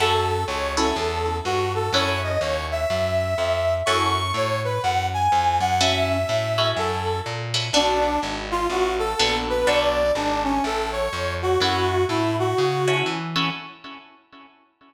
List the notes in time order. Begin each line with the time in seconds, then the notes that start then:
0.00 F#2 C#4 E4 F#4 A4
0.48 C#2 C#5
0.77 C#4 E4 F#4 A4
0.96 E2
1.45 G2 F#4
1.75 A4
1.93 F#2 C#4 E4 F#4 A4 C#5
2.23 D#5
2.41 D#2 C#5
2.71 E5
2.90 F#2
3.38 F2
3.86 F#2 C#4 E4 F#4 A4 C#6
4.34 A2 C#5
4.64 B4
4.83 F#2 F#5
5.14 G#5
5.32 F2
5.60 F#2 F#5
5.81 C#4 E4 F#4 A4 E5
6.09 E5
6.29 A2
6.58 C#4 E4 F#4 A4
6.77 F#2 A4
7.26 A#2
7.54 C#4 E4 F#4 A4
7.73 B1 B3 D4 F#4 A4
8.23 G#1
8.51 F4
8.70 A1 F#4
8.99 A4
9.19 A#1 B3 D4 F#4 A4
9.49 B4
9.67 B1 B3 D4 F#4 A4 D5
10.15 G#1 D4
10.44 C#4
10.64 A1 A4
10.92 C#5
11.13 F2
11.42 F#4
11.60 F#2 C#4 E4 F#4 A4
12.09 A2 E4
12.39 F#4
12.58 C#3
12.88 C#4 E4 F#4 A4
13.06 E3
13.36 C#4 E4 F#4 A4